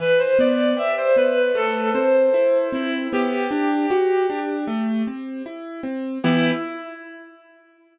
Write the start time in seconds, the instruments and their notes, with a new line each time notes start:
0.00 acoustic grand piano E3, clarinet B4
0.19 clarinet C5
0.39 acoustic grand piano B3, clarinet D5
0.77 acoustic grand piano G4, clarinet E5
0.98 clarinet C5
1.16 acoustic grand piano B3, clarinet B4
1.55 acoustic grand piano A3, clarinet A4
1.94 acoustic grand piano C4, clarinet C5
2.34 acoustic grand piano E4
2.73 acoustic grand piano C4, clarinet E4
3.13 acoustic grand piano B3, clarinet G4
3.51 acoustic grand piano D4
3.90 acoustic grand piano F#4
4.30 acoustic grand piano D4
4.67 acoustic grand piano A3
5.07 acoustic grand piano C4
5.46 acoustic grand piano E4
5.83 acoustic grand piano C4
6.24 acoustic grand piano E3 B3 G4, clarinet E4